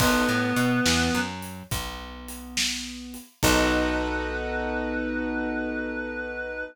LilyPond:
<<
  \new Staff \with { instrumentName = "Clarinet" } { \time 12/8 \key b \major \tempo 4. = 70 <b b'>2~ <b b'>8 r2. r8 | b'1. | }
  \new Staff \with { instrumentName = "Acoustic Grand Piano" } { \time 12/8 \key b \major <b dis' fis' a'>8 a8 b8 e8 fis4 b2. | <b dis' fis' a'>1. | }
  \new Staff \with { instrumentName = "Electric Bass (finger)" } { \clef bass \time 12/8 \key b \major b,,8 a,8 b,8 e,8 fis,4 b,,2. | b,,1. | }
  \new DrumStaff \with { instrumentName = "Drums" } \drummode { \time 12/8 <cymc bd>4 hh8 sn4 hh8 <hh bd>4 hh8 sn4 hh8 | <cymc bd>4. r4. r4. r4. | }
>>